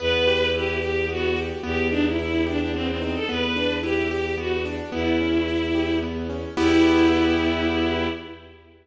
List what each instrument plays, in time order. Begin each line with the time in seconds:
0.00 violin E2 B4, acoustic grand piano B3
0.27 acoustic grand piano G4
0.54 acoustic grand piano E4, violin G4
0.82 acoustic grand piano G4, violin G4
1.09 acoustic grand piano B3, violin F#4
1.36 acoustic grand piano G4
1.63 violin E2 G4, acoustic grand piano B3
1.91 violin D4, acoustic grand piano D#4
2.06 violin E4
2.19 acoustic grand piano E4, violin E4
2.47 violin D4, acoustic grand piano G4
2.60 violin D4
2.73 acoustic grand piano B3, violin C4
2.88 violin C4
3.01 violin C4, acoustic grand piano D#4
3.15 violin A4
3.29 violin E2 B4, acoustic grand piano B3
3.56 acoustic grand piano D4
3.83 acoustic grand piano E4, violin G4
4.11 violin G4, acoustic grand piano G4
4.38 acoustic grand piano B3, violin F#4
4.65 acoustic grand piano D4
4.92 violin E2 E4, acoustic grand piano B3
5.21 acoustic grand piano C#4
5.48 acoustic grand piano E4
5.75 acoustic grand piano G4
6.03 acoustic grand piano B3
6.30 acoustic grand piano C#4
6.57 violin E2 E4, acoustic grand piano B3 E4 G4